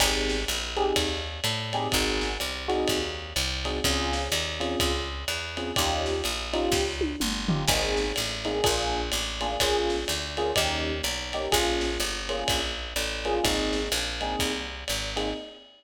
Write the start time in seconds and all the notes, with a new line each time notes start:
0.00 G#1 C4 D#4 G4 G#4, kick, crash, ride
0.29 snare
0.48 A#1, hi-hat pedal, ride
0.76 C4 D#4 G4 G#4, ride
0.96 D#2, kick, ride
1.44 A2, hi-hat pedal, ride
1.73 C4 D#4 G4 G#4, ride
1.92 G#1 C4 D#4 F#4 G#4, kick, ride
2.21 snare
2.40 C2, hi-hat pedal, ride
2.68 C4 D#4 F#4 G#4, ride
2.88 D#2, kick, ride
3.36 C2, hi-hat pedal, ride
3.65 C4 D#4 F#4 G#4, ride
3.84 C#2 C4 C#4 F4 G#4, kick, ride
4.13 snare
4.32 D#2, hi-hat pedal, ride
4.60 C4 C#4 F4 G#4, ride
4.80 C#2, kick, ride
5.28 E2, hi-hat pedal, ride
5.57 C4 C#4 F4 G#4, ride
5.76 D#2 C#4 D#4 F4 G4, kick, ride
6.06 snare
6.24 A#1, hi-hat pedal, ride
6.53 C#4 D#4 F4 G4, ride
6.72 C#2, kick, snare
7.01 high tom
7.20 G1, mid tom
7.49 C#4 D#4 F4 G4, floor tom
7.68 G#1 A#3 C4 D#4 G#4, kick, crash, ride
7.97 snare
8.16 A1, hi-hat pedal, ride
8.45 A#3 C4 D#4 G#4, ride
8.64 A#1 A#3 D4 F4 G#4, kick, ride
9.12 A1, hi-hat pedal, ride
9.41 A#3 D4 F4 G#4, ride
9.60 A#1 A#3 C#4 F4 G#4, kick, ride
9.90 snare
10.08 D2, hi-hat pedal, ride
10.37 A#3 C#4 F4 G#4, ride
10.56 D#2 A#3 C#4 D#4 G4, kick, ride
11.03 B1, hi-hat pedal, ride
11.33 A#3 C#4 D#4 G4, ride
11.52 A#1 A#3 C#4 F4 G#4, kick, ride
11.81 snare
12.00 G1, hi-hat pedal, ride
12.29 A#3 C#4 F4 G#4, ride
12.48 A#1, kick, ride
12.96 A1, hi-hat pedal, ride
13.25 A#3 C#4 F4 G#4, ride
13.44 G#1 A#3 C4 D#4 G#4, kick, ride
13.73 snare
13.92 A#1, hi-hat pedal, ride
14.21 A#3 C4 D#4 G#4, ride
14.39 C2, kick, ride
14.88 G#1, hi-hat pedal, ride
15.16 A#3 C4 D#4 G#4, ride